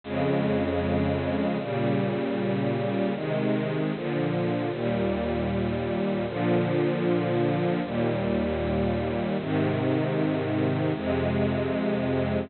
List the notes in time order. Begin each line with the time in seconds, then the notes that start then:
0.04 F2 C#3 G#3
1.59 A#2 C#3 G3
3.15 C3 D#3 G#3
3.94 A#2 D3 F3
4.71 D#2 A#2 G3
6.27 A#2 D3 F3
7.83 D#2 A#2 G3
9.38 G#2 C3 D#3
10.94 F2 C3 G#3